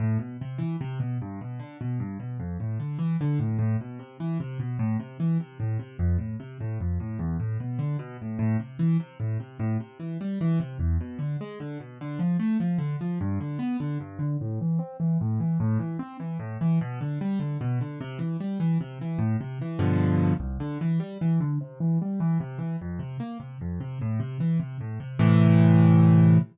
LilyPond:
\new Staff { \time 6/8 \key a \minor \tempo 4. = 100 a,8 b,8 c8 e8 c8 b,8 | g,8 b,8 d8 b,8 g,8 b,8 | f,8 a,8 d8 e8 d8 a,8 | a,8 b,8 c8 e8 c8 b,8 |
a,8 c8 e8 c8 a,8 c8 | f,8 a,8 c8 a,8 f,8 a,8 | e,8 a,8 b,8 d8 b,8 a,8 | a,8 c8 e8 c8 a,8 c8 |
a,8 c8 e8 g8 e8 c8 | e,8 b,8 d8 gis8 d8 b,8 | d8 f8 a8 f8 d8 f8 | g,8 d8 b8 d8 g,8 d8 |
a,8 e8 c'8 e8 a,8 e8 | a,8 e8 c'8 e8 a,8 e8 | b,8 d8 g8 d8 b,8 d8 | c8 e8 g8 e8 c8 e8 |
a,8 c8 e8 <g, b, d f>4. | c,8 d8 e8 g8 e8 d8 | c8 e8 g8 e8 c8 e8 | f,8 c8 bes8 c8 f,8 c8 |
a,8 c8 e8 c8 a,8 c8 | <a, c e>2. | }